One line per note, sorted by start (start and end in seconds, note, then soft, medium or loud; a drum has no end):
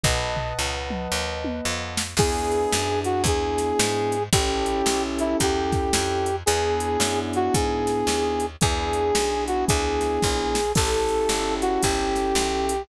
0.04 0.53 B1 medium
0.04 2.02 B4 medium
0.04 2.02 D#5 loud
0.04 2.02 F#5 medium
0.04 2.02 A5 medium
0.04 kick medium
0.04 floor tom medium
0.36 floor tom medium
0.59 1.08 C#2 medium
0.90 mid tom medium
1.12 1.61 D#2 medium
1.44 high tom medium
1.65 2.15 F2 medium
1.97 snare loud
2.17 2.66 E2 medium
2.17 4.16 B3 loud
2.17 4.16 D4 loud
2.17 4.16 E4 medium
2.17 4.16 G#4 loud
2.17 3.00 G#4 medium
2.17 kick loud
2.17 crash loud
2.52 closed hi-hat medium
2.73 3.23 F#2 medium
2.73 snare loud
3.04 3.22 F#4 medium
3.04 closed hi-hat medium
3.24 3.73 E2 medium
3.24 4.23 G#4 medium
3.24 kick medium
3.24 closed hi-hat loud
3.58 snare medium
3.58 closed hi-hat medium
3.79 4.29 G#2 medium
3.79 snare loud
4.12 closed hi-hat medium
4.33 4.82 A1 medium
4.33 6.30 C#4 loud
4.33 6.30 E4 loud
4.33 6.30 G4 medium
4.33 5.03 G4 medium
4.33 6.30 A4 loud
4.33 kick loud
4.33 closed hi-hat loud
4.66 closed hi-hat medium
4.86 5.35 B1 medium
4.86 snare loud
5.19 5.37 E4 medium
5.19 closed hi-hat medium
5.40 5.90 E2 medium
5.40 6.36 G4 medium
5.40 kick medium
5.40 closed hi-hat loud
5.72 kick medium
5.72 snare medium
5.72 closed hi-hat medium
5.93 6.43 F2 medium
5.93 snare loud
6.26 closed hi-hat medium
6.46 6.97 E2 medium
6.46 8.45 B3 loud
6.46 8.45 D4 loud
6.46 8.45 E4 loud
6.46 7.19 G#4 medium
6.46 8.45 G#4 loud
6.46 closed hi-hat loud
6.80 closed hi-hat medium
7.00 7.49 F#2 medium
7.00 snare loud
7.33 7.54 F#4 medium
7.33 closed hi-hat medium
7.54 8.04 G#2 medium
7.54 8.46 G#4 medium
7.54 kick medium
7.54 closed hi-hat loud
7.87 snare medium
7.87 closed hi-hat medium
8.07 8.56 D#2 medium
8.07 snare medium
8.40 closed hi-hat medium
8.61 9.12 E2 medium
8.61 10.59 B3 medium
8.61 10.59 D4 loud
8.61 10.59 E4 loud
8.61 10.59 G#4 loud
8.61 9.44 G#4 medium
8.61 kick loud
8.61 closed hi-hat medium
8.93 closed hi-hat medium
9.15 9.65 B1 medium
9.15 snare loud
9.47 9.65 F#4 medium
9.47 closed hi-hat medium
9.68 10.19 D2 medium
9.68 10.72 G#4 medium
9.68 kick medium
9.68 closed hi-hat loud
10.01 snare medium
10.01 closed hi-hat medium
10.22 10.73 A#1 medium
10.22 kick medium
10.22 snare medium
10.55 snare medium
10.75 11.26 A1 medium
10.75 12.73 C#4 loud
10.75 12.73 E4 loud
10.75 12.73 G4 loud
10.75 12.73 A4 loud
10.75 11.54 A4 medium
10.75 kick loud
10.75 crash loud
11.08 closed hi-hat medium
11.29 11.78 G1 medium
11.29 snare loud
11.61 11.82 F#4 medium
11.61 closed hi-hat medium
11.83 12.33 G1 medium
11.83 12.82 G4 medium
11.83 kick medium
11.83 closed hi-hat loud
12.16 snare medium
12.16 closed hi-hat medium
12.35 12.85 B1 medium
12.35 snare loud
12.69 closed hi-hat medium